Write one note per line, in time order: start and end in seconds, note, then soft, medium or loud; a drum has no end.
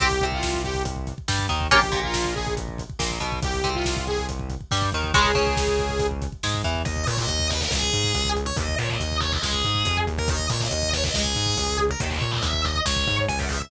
0.00 0.18 C2 medium
0.00 0.08 C4 loud
0.00 0.08 G4 medium
0.00 0.25 G4 loud
0.00 kick medium
0.00 closed hi-hat loud
0.11 kick medium
0.20 1.12 C2 medium
0.20 1.14 C3 medium
0.20 kick medium
0.20 closed hi-hat medium
0.32 0.62 F4 medium
0.32 kick medium
0.43 kick medium
0.43 snare medium
0.54 kick medium
0.64 0.83 G4 medium
0.64 kick medium
0.64 closed hi-hat medium
0.74 kick medium
0.85 kick medium
0.85 closed hi-hat loud
0.96 kick medium
1.07 kick medium
1.07 closed hi-hat medium
1.18 kick medium
1.28 1.47 G2 medium
1.28 1.46 G3 medium
1.28 kick medium
1.28 snare loud
1.39 kick medium
1.49 1.68 D#2 medium
1.49 1.67 D#3 medium
1.49 kick medium
1.49 closed hi-hat medium
1.61 kick medium
1.71 1.90 A#1 medium
1.71 1.80 A#3 loud
1.71 1.80 C#4 loud
1.71 1.80 F4 loud
1.71 2.00 G4 medium
1.71 kick medium
1.71 closed hi-hat loud
1.83 kick medium
1.92 2.83 A#1 medium
1.92 2.83 A#2 medium
1.92 kick medium
1.92 closed hi-hat medium
2.03 2.34 F4 medium
2.03 kick medium
2.14 kick medium
2.14 snare loud
2.25 kick medium
2.35 2.54 G#4 medium
2.35 kick medium
2.35 closed hi-hat medium
2.47 kick medium
2.57 kick medium
2.57 closed hi-hat medium
2.68 kick medium
2.78 kick medium
2.78 closed hi-hat medium
2.90 kick medium
2.99 3.18 A#1 medium
2.99 3.18 A#2 medium
2.99 kick medium
2.99 snare loud
3.11 kick medium
3.20 3.40 B1 medium
3.20 3.39 B2 medium
3.20 kick medium
3.20 closed hi-hat medium
3.32 kick medium
3.42 3.61 C2 medium
3.42 3.70 G4 medium
3.42 kick loud
3.42 closed hi-hat loud
3.54 kick medium
3.64 4.55 C2 medium
3.64 4.55 C3 medium
3.64 kick medium
3.64 closed hi-hat medium
3.74 4.05 F4 medium
3.74 kick medium
3.85 kick medium
3.85 snare loud
3.97 kick medium
4.07 4.26 G#4 medium
4.07 kick medium
4.07 closed hi-hat medium
4.18 kick medium
4.29 kick medium
4.29 closed hi-hat medium
4.39 kick medium
4.50 kick medium
4.50 closed hi-hat medium
4.61 kick medium
4.71 4.90 G2 medium
4.71 4.90 G3 medium
4.71 kick medium
4.71 snare medium
4.82 kick medium
4.92 5.11 D#2 medium
4.92 5.12 D#3 medium
4.92 kick medium
4.92 closed hi-hat medium
5.04 kick medium
5.14 5.33 C#2 medium
5.14 5.31 C#3 loud
5.14 5.31 G#3 loud
5.14 6.07 G#4 medium
5.14 kick loud
5.14 closed hi-hat medium
5.25 kick medium
5.35 6.26 C#2 medium
5.35 6.26 C#3 medium
5.35 kick medium
5.35 closed hi-hat medium
5.47 kick medium
5.57 kick medium
5.57 snare medium
5.67 kick medium
5.79 kick medium
5.79 closed hi-hat medium
5.89 kick medium
5.99 kick medium
5.99 closed hi-hat medium
6.11 kick medium
6.22 kick medium
6.22 closed hi-hat medium
6.32 kick medium
6.43 6.62 G#2 medium
6.43 6.62 G#3 medium
6.43 kick medium
6.43 snare medium
6.54 kick medium
6.64 6.82 E2 medium
6.64 6.82 E3 medium
6.64 kick medium
6.64 closed hi-hat medium
6.75 kick medium
6.85 7.05 D#2 medium
6.85 7.04 D#5 medium
6.85 kick loud
6.85 closed hi-hat medium
6.96 kick medium
7.07 7.26 A#2 medium
7.07 7.17 C#5 medium
7.07 kick medium
7.07 closed hi-hat medium
7.17 7.47 D#5 medium
7.17 kick medium
7.28 7.64 D#2 medium
7.28 kick medium
7.28 closed hi-hat loud
7.39 kick medium
7.50 7.61 B4 medium
7.50 kick medium
7.50 closed hi-hat medium
7.61 7.71 A#4 medium
7.61 kick medium
7.71 7.89 C#2 medium
7.71 8.29 G#4 medium
7.71 kick medium
7.71 snare medium
7.82 kick medium
7.93 8.12 G#2 medium
7.93 kick medium
7.93 closed hi-hat medium
8.04 kick medium
8.14 8.50 C#2 medium
8.14 kick medium
8.14 closed hi-hat loud
8.25 kick medium
8.36 kick medium
8.36 closed hi-hat medium
8.46 8.56 C#5 medium
8.46 kick medium
8.56 8.75 D#2 medium
8.56 8.75 D#5 medium
8.56 kick loud
8.56 closed hi-hat medium
8.69 kick medium
8.78 8.97 A#2 medium
8.78 8.89 C#5 medium
8.78 kick medium
8.78 closed hi-hat medium
8.89 9.16 D#5 medium
8.89 kick medium
9.00 9.36 D#2 medium
9.00 kick medium
9.00 closed hi-hat medium
9.11 kick medium
9.21 9.31 C#5 medium
9.21 kick medium
9.21 closed hi-hat medium
9.32 9.43 D#5 medium
9.32 kick medium
9.42 9.61 C#2 medium
9.42 9.97 G#4 medium
9.42 kick medium
9.42 snare loud
9.53 kick medium
9.64 9.83 G#2 medium
9.64 kick medium
9.64 closed hi-hat medium
9.75 kick medium
9.85 10.05 F2 medium
9.85 kick medium
9.85 closed hi-hat loud
9.97 kick medium
10.07 10.47 D#2 medium
10.07 kick medium
10.07 closed hi-hat medium
10.18 10.29 A#4 medium
10.18 kick medium
10.28 10.46 D#5 medium
10.28 kick loud
10.28 closed hi-hat loud
10.39 kick medium
10.49 10.68 A#2 medium
10.49 10.60 C#5 medium
10.49 kick medium
10.49 closed hi-hat medium
10.60 10.88 D#5 medium
10.60 kick medium
10.71 11.08 D#2 medium
10.71 kick medium
10.71 closed hi-hat loud
10.83 kick medium
10.93 11.04 C#5 medium
10.93 kick medium
10.93 closed hi-hat medium
11.04 11.14 D#5 medium
11.04 kick medium
11.14 11.33 C#2 medium
11.14 11.77 G#4 medium
11.14 kick medium
11.14 snare loud
11.25 kick medium
11.35 11.54 G#2 medium
11.35 kick medium
11.35 closed hi-hat medium
11.46 kick medium
11.57 11.93 C#2 medium
11.57 kick medium
11.57 closed hi-hat medium
11.68 kick medium
11.78 kick medium
11.78 closed hi-hat medium
11.89 12.01 A#4 medium
11.89 kick medium
12.00 12.18 D#2 medium
12.00 12.11 D#5 loud
12.00 kick medium
12.00 closed hi-hat loud
12.10 12.31 C#5 medium
12.10 kick medium
12.21 12.40 A#2 medium
12.21 kick medium
12.21 closed hi-hat medium
12.31 12.42 D#5 medium
12.31 kick medium
12.42 12.79 D#2 medium
12.42 12.61 E5 medium
12.42 kick medium
12.42 closed hi-hat loud
12.53 kick medium
12.64 12.75 D#5 medium
12.64 kick medium
12.64 closed hi-hat medium
12.75 kick medium
12.86 13.04 C#2 medium
12.86 13.16 C#5 medium
12.86 kick medium
12.86 snare loud
12.96 kick medium
13.07 13.26 G#2 medium
13.07 kick medium
13.07 closed hi-hat medium
13.18 kick medium
13.28 13.65 C#2 medium
13.28 13.39 G#5 medium
13.28 kick medium
13.28 closed hi-hat medium
13.39 13.49 F#5 medium
13.39 kick medium
13.49 13.59 E5 medium
13.49 kick medium
13.49 closed hi-hat medium
13.61 13.70 E5 medium
13.61 kick medium